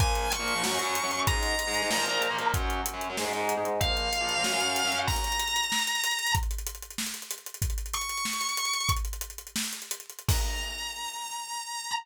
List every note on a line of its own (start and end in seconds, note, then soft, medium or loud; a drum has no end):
0.00 0.26 A#2 loud
0.00 0.26 F3 medium
0.00 0.26 A#3 medium
0.00 0.30 G#5 medium
0.00 kick loud
0.00 closed hi-hat medium
0.15 closed hi-hat medium
0.32 1.19 C#6 medium
0.32 closed hi-hat medium
0.39 0.52 A#2 medium
0.39 0.52 F3 medium
0.39 0.52 A#3 medium
0.48 closed hi-hat medium
0.55 0.62 A#2 medium
0.55 0.62 F3 medium
0.55 0.62 A#3 medium
0.63 0.70 F#2 medium
0.63 0.70 F#3 medium
0.63 0.70 C#4 medium
0.63 snare medium
0.71 0.78 F#2 medium
0.71 0.78 F#3 medium
0.71 0.78 C#4 medium
0.79 0.98 F#2 medium
0.79 0.98 F#3 medium
0.79 0.98 C#4 medium
0.79 closed hi-hat medium
0.95 closed hi-hat medium
1.03 1.10 F#2 medium
1.03 1.10 F#3 medium
1.03 1.10 C#4 medium
1.11 1.24 F#2 medium
1.11 1.24 F#3 medium
1.11 1.24 C#4 medium
1.11 closed hi-hat medium
1.27 1.53 G#2 medium
1.27 1.53 G#3 medium
1.27 1.53 D#4 medium
1.27 2.46 A#5 soft
1.27 kick loud
1.27 closed hi-hat medium
1.43 closed hi-hat medium
1.59 closed hi-hat medium
1.67 1.80 G#2 medium
1.67 1.80 G#3 medium
1.67 1.80 D#4 medium
1.74 closed hi-hat medium
1.82 1.89 G#2 medium
1.82 1.89 G#3 medium
1.82 1.89 D#4 medium
1.90 1.97 A#2 medium
1.90 1.97 F3 medium
1.90 1.97 A#3 medium
1.90 snare medium
1.98 2.04 A#2 medium
1.98 2.04 F3 medium
1.98 2.04 A#3 medium
2.06 2.26 A#2 medium
2.06 2.26 F3 medium
2.06 2.26 A#3 medium
2.06 closed hi-hat medium
2.22 closed hi-hat medium
2.30 2.37 A#2 medium
2.30 2.37 F3 medium
2.30 2.37 A#3 medium
2.38 2.51 A#2 medium
2.38 2.51 F3 medium
2.38 2.51 A#3 medium
2.38 closed hi-hat medium
2.54 2.79 F#2 medium
2.54 2.79 F#3 medium
2.54 2.79 C#4 medium
2.54 kick medium
2.54 closed hi-hat medium
2.70 closed hi-hat medium
2.86 closed hi-hat loud
2.93 3.06 F#2 medium
2.93 3.06 F#3 medium
2.93 3.06 C#4 medium
3.01 closed hi-hat medium
3.10 3.16 F#2 medium
3.10 3.16 F#3 medium
3.10 3.16 C#4 medium
3.17 3.24 G#2 medium
3.17 3.24 G#3 medium
3.17 3.24 D#4 medium
3.17 snare medium
3.25 3.31 G#2 medium
3.25 3.31 G#3 medium
3.25 3.31 D#4 medium
3.33 3.52 G#2 medium
3.33 3.52 G#3 medium
3.33 3.52 D#4 medium
3.33 closed hi-hat soft
3.49 closed hi-hat medium
3.57 3.64 G#2 medium
3.57 3.64 G#3 medium
3.57 3.64 D#4 medium
3.64 3.77 G#2 medium
3.64 3.77 G#3 medium
3.64 3.77 D#4 medium
3.64 closed hi-hat medium
3.80 4.07 A#2 medium
3.80 4.07 F3 medium
3.80 4.07 A#3 medium
3.80 4.98 F5 medium
3.80 kick medium
3.80 closed hi-hat medium
3.97 closed hi-hat medium
4.13 closed hi-hat medium
4.21 4.34 A#2 medium
4.21 4.34 F3 medium
4.21 4.34 A#3 medium
4.29 closed hi-hat medium
4.37 4.43 A#2 medium
4.37 4.43 F3 medium
4.37 4.43 A#3 medium
4.44 4.51 F#2 medium
4.44 4.51 F#3 medium
4.44 4.51 C#4 medium
4.44 snare medium
4.53 4.59 F#2 medium
4.53 4.59 F#3 medium
4.53 4.59 C#4 medium
4.60 4.80 F#2 medium
4.60 4.80 F#3 medium
4.60 4.80 C#4 medium
4.60 closed hi-hat medium
4.76 closed hi-hat medium
4.84 4.91 F#2 medium
4.84 4.91 F#3 medium
4.84 4.91 C#4 medium
4.92 5.05 F#2 medium
4.92 5.05 F#3 medium
4.92 5.05 C#4 medium
4.92 closed hi-hat medium
5.07 6.32 A#5 medium
5.07 kick medium
5.07 crash medium
5.16 closed hi-hat medium
5.24 closed hi-hat medium
5.32 closed hi-hat medium
5.39 closed hi-hat medium
5.48 closed hi-hat medium
5.56 closed hi-hat medium
5.63 closed hi-hat medium
5.72 snare medium
5.79 closed hi-hat medium
5.87 closed hi-hat medium
5.95 closed hi-hat medium
6.04 closed hi-hat medium
6.11 closed hi-hat medium
6.19 closed hi-hat medium
6.27 closed hi-hat medium
6.35 kick loud
6.35 closed hi-hat medium
6.43 closed hi-hat medium
6.51 closed hi-hat medium
6.58 closed hi-hat medium
6.67 closed hi-hat medium
6.75 closed hi-hat medium
6.82 closed hi-hat medium
6.91 closed hi-hat medium
6.98 snare medium
7.06 closed hi-hat medium
7.14 closed hi-hat medium
7.22 closed hi-hat medium
7.31 closed hi-hat medium
7.38 closed hi-hat medium
7.46 closed hi-hat medium
7.54 closed hi-hat medium
7.62 kick medium
7.62 closed hi-hat medium
7.70 closed hi-hat medium
7.78 closed hi-hat medium
7.86 closed hi-hat medium
7.94 8.88 C#6 medium
7.94 closed hi-hat medium
8.01 closed hi-hat medium
8.09 closed hi-hat medium
8.17 closed hi-hat medium
8.25 snare medium
8.33 closed hi-hat medium
8.41 closed hi-hat medium
8.49 closed hi-hat medium
8.57 closed hi-hat medium
8.65 closed hi-hat medium
8.73 closed hi-hat medium
8.80 closed hi-hat medium
8.89 kick medium
8.89 closed hi-hat medium
8.97 closed hi-hat medium
9.05 closed hi-hat medium
9.13 closed hi-hat medium
9.21 closed hi-hat medium
9.30 closed hi-hat medium
9.38 closed hi-hat medium
9.47 closed hi-hat medium
9.56 snare loud
9.64 closed hi-hat medium
9.73 closed hi-hat medium
9.82 closed hi-hat medium
9.91 closed hi-hat medium
10.00 closed hi-hat medium
10.10 closed hi-hat medium
10.19 closed hi-hat medium
10.28 11.91 A#5 loud
10.28 kick loud
10.28 crash loud